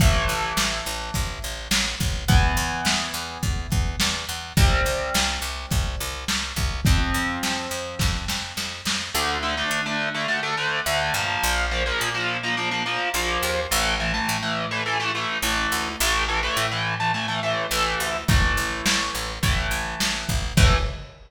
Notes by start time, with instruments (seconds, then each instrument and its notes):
0.00 electric bass (finger) A1, overdriven guitar E3 A3, kick, closed hi-hat
0.28 electric bass (finger) A1, closed hi-hat
0.57 electric bass (finger) A1, snare
0.85 electric bass (finger) A1, closed hi-hat
1.14 electric bass (finger) A1, kick, closed hi-hat
1.42 electric bass (finger) A1, closed hi-hat
1.71 electric bass (finger) A1, snare
2.00 electric bass (finger) A1, kick, closed hi-hat
2.28 electric bass (finger) E2, overdriven guitar E3 B3, kick, closed hi-hat
2.57 electric bass (finger) E2, closed hi-hat
2.85 electric bass (finger) E2, snare
3.14 electric bass (finger) E2, closed hi-hat
3.43 electric bass (finger) E2, kick, closed hi-hat
3.70 electric bass (finger) E2, kick, closed hi-hat
4.00 electric bass (finger) E2, snare
4.29 electric bass (finger) E2, closed hi-hat
4.57 electric bass (finger) C2, overdriven guitar G3 C4, kick, closed hi-hat
4.85 electric bass (finger) C2, closed hi-hat
5.14 electric bass (finger) C2, snare
5.42 electric bass (finger) C2, closed hi-hat
5.71 electric bass (finger) C2, kick, closed hi-hat
6.00 electric bass (finger) C2, closed hi-hat
6.28 electric bass (finger) C2, snare
6.56 electric bass (finger) C2, kick, closed hi-hat
6.85 electric bass (finger) F2, overdriven guitar F3 C4, kick, closed hi-hat
7.14 electric bass (finger) F2, closed hi-hat
7.43 electric bass (finger) F2, snare
7.70 electric bass (finger) F2, closed hi-hat
7.99 electric bass (finger) F2, kick, snare
8.28 electric bass (finger) F2, snare
8.57 electric bass (finger) F2, snare
8.85 electric bass (finger) F2, snare
9.14 electric bass (finger) D2, overdriven guitar D3 A3
9.43 overdriven guitar D3 A3
9.57 overdriven guitar D3 A3
9.71 electric bass (finger) D3
9.86 overdriven guitar D3 A3
10.15 overdriven guitar D3 A3
10.28 overdriven guitar D3 A3
10.43 overdriven guitar D3 A3
10.57 overdriven guitar D3 A3
10.86 electric bass (finger) D2, overdriven guitar D3 A3
11.14 electric bass (finger) G2, overdriven guitar F3 A#3
11.43 electric bass (finger) A#1
11.71 overdriven guitar F3 A#3
11.86 overdriven guitar F3 A#3
12.01 electric bass (finger) A#2
12.14 overdriven guitar F3 A#3
12.43 overdriven guitar F3 A#3
12.57 overdriven guitar F3 A#3
12.71 overdriven guitar F3 A#3
12.86 overdriven guitar F3 A#3
13.14 electric bass (finger) A#1, overdriven guitar F3 A#3
13.43 electric bass (finger) D#2
13.71 electric bass (finger) A1, overdriven guitar E3 A3
14.00 overdriven guitar E3 A3
14.14 overdriven guitar E3 A3
14.29 electric bass (finger) A2
14.43 overdriven guitar E3 A3
14.71 overdriven guitar E3 A3
14.86 overdriven guitar E3 A3
15.00 overdriven guitar E3 A3
15.15 overdriven guitar E3 A3
15.42 electric bass (finger) A1, overdriven guitar E3 A3
15.72 electric bass (finger) D2
16.00 electric bass (finger) A1, overdriven guitar E3 A3
16.28 overdriven guitar E3 A3
16.43 overdriven guitar E3 A3
16.57 electric bass (finger) A2
16.71 overdriven guitar E3 A3
17.00 overdriven guitar E3 A3
17.14 overdriven guitar E3 A3
17.28 overdriven guitar E3 A3
17.43 overdriven guitar E3 A3
17.71 electric bass (finger) A1, overdriven guitar E3 A3
18.00 electric bass (finger) D2
18.28 electric bass (finger) A1, overdriven guitar E3 A3, kick, crash
18.57 electric bass (finger) A1, closed hi-hat
18.86 electric bass (finger) A1, snare
19.14 electric bass (finger) A1, closed hi-hat
19.43 electric bass (finger) A1, overdriven guitar E3 A3, kick, closed hi-hat
19.71 electric bass (finger) A1, closed hi-hat
20.00 electric bass (finger) A1, snare
20.28 electric bass (finger) A1, kick, open hi-hat
20.57 electric bass (finger) A2, overdriven guitar E3 A3, kick, crash